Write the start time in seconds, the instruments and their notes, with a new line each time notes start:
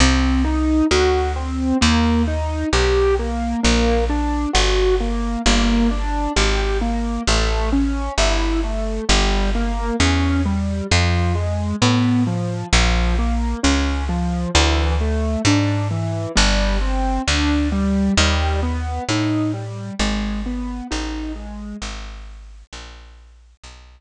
0.00 electric bass (finger) C2, acoustic grand piano C4
0.45 acoustic grand piano D#4
0.91 electric bass (finger) D2, acoustic grand piano F#4
1.36 acoustic grand piano C4
1.81 electric bass (finger) D#2, acoustic grand piano A#3
2.27 acoustic grand piano D#4
2.73 electric bass (finger) B1, acoustic grand piano G4
3.19 acoustic grand piano A#3
3.63 electric bass (finger) A#1, acoustic grand piano A#3
4.09 acoustic grand piano D4
4.53 electric bass (finger) G1, acoustic grand piano F#4
5.00 acoustic grand piano A#3
5.46 electric bass (finger) G1, acoustic grand piano A#3
5.91 acoustic grand piano D4
6.36 electric bass (finger) G#1, acoustic grand piano G4
6.81 acoustic grand piano A#3
7.27 electric bass (finger) A1, acoustic grand piano A3
7.73 acoustic grand piano C#4
8.18 electric bass (finger) G1, acoustic grand piano E4
8.63 acoustic grand piano A3
9.09 electric bass (finger) G1, acoustic grand piano G3
9.55 acoustic grand piano A#3
10.00 electric bass (finger) E2, acoustic grand piano C#4
10.45 acoustic grand piano G3
10.91 electric bass (finger) F2, acoustic grand piano F3
11.35 acoustic grand piano G#3
11.82 electric bass (finger) A2, acoustic grand piano B3
12.27 acoustic grand piano F3
12.73 electric bass (finger) A#1, acoustic grand piano F3
13.19 acoustic grand piano A#3
13.63 electric bass (finger) C#2, acoustic grand piano C#4
14.09 acoustic grand piano F3
14.55 electric bass (finger) D2, acoustic grand piano E3
15.01 acoustic grand piano A3
15.45 electric bass (finger) G#2, acoustic grand piano D4
15.91 acoustic grand piano E3
16.35 electric bass (finger) G1, acoustic grand piano G3
16.81 acoustic grand piano C4
17.27 electric bass (finger) D2, acoustic grand piano D4
17.72 acoustic grand piano G3
18.17 electric bass (finger) D#2, acoustic grand piano G3
18.63 acoustic grand piano B3
19.09 electric bass (finger) A2, acoustic grand piano D#4
19.54 acoustic grand piano G3
19.99 electric bass (finger) G#1, acoustic grand piano G#3
20.46 acoustic grand piano B3
20.91 electric bass (finger) A1, acoustic grand piano D#4
21.35 acoustic grand piano G#3
21.82 electric bass (finger) G#1
22.73 electric bass (finger) A#1
23.63 electric bass (finger) B1